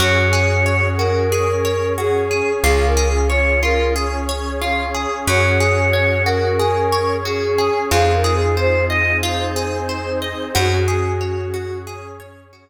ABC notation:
X:1
M:4/4
L:1/8
Q:1/4=91
K:Gblyd
V:1 name="Choir Aahs"
d3 B3 A2 | (3A B A d B z4 | d3 B3 A2 | (3A B A c e z4 |
G4 z4 |]
V:2 name="Orchestral Harp"
G A d G A d G A | F A d F A d F A | G A d G A d G A | F A c e F A c e |
G A d G A d G z |]
V:3 name="Electric Bass (finger)" clef=bass
G,,8 | D,,8 | G,,8 | F,,8 |
G,,8 |]
V:4 name="Pad 2 (warm)"
[DGA]4 [DAd]4 | [DFA]4 [DAd]4 | [DGA]4 [DAd]4 | [CEFA]4 [CEAc]4 |
[DGA]4 [DAd]4 |]